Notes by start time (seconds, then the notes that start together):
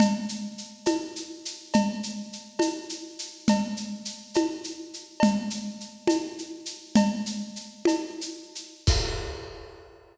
0.00 cowbell, low conga, shaker
0.29 shaker
0.58 shaker
0.86 cowbell, high conga, shaker
1.16 shaker
1.45 shaker
1.73 cowbell, low conga, shaker
2.03 shaker
2.33 shaker
2.59 cowbell, high conga, shaker
2.89 shaker
3.19 shaker
3.48 cowbell, low conga, shaker
3.77 shaker
4.05 shaker
4.34 cowbell, high conga, shaker
4.64 shaker
4.93 shaker
5.20 cowbell, low conga, shaker
5.50 shaker
5.80 shaker
6.07 cowbell, high conga, shaker
6.38 shaker
6.66 shaker
6.95 cowbell, low conga, shaker
7.26 shaker
7.56 shaker
7.85 cowbell, high conga, shaker
8.21 shaker
8.55 shaker
8.87 kick, crash